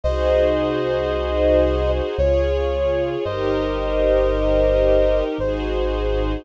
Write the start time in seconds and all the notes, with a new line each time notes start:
0.04 C2 D#4 F#4 G#4 C5 D#5
2.18 C#2 F4 G#4 C#5
3.25 G1 D#4 G4 A#4 C5 D#5
5.38 G#1 D#4 F#4 G#4 C5